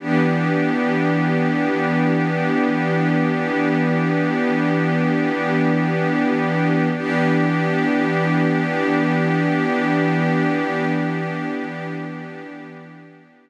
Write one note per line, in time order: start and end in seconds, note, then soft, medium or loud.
0.00 6.89 E3 medium
0.00 6.89 B3 medium
0.00 6.89 D4 medium
0.00 6.89 G4 medium
6.95 13.50 E3 medium
6.95 13.50 B3 medium
6.95 13.50 D4 medium
6.95 13.50 G4 medium